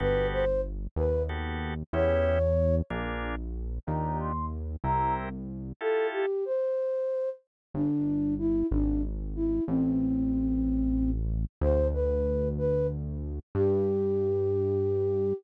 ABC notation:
X:1
M:6/8
L:1/8
Q:3/8=62
K:Gmix
V:1 name="Flute"
B c z B z2 | ^c3 z3 | _b c' z b z2 | A G c3 z |
D2 E D z E | C5 z | c B2 B z2 | G6 |]
V:2 name="Drawbar Organ"
[B,^FGA]4 [B,FGA]2 | [B,^CEG]3 [_B,DF_A]3 | [D_EFG]3 [C=EG_B]3 | [EFGA]6 |
z6 | z6 | z6 | z6 |]
V:3 name="Synth Bass 1" clef=bass
G,,,3 _E,,3 | E,,3 _B,,,3 | _E,,3 C,,3 | z6 |
G,,,3 ^G,,,3 | A,,,6 | D,,6 | G,,6 |]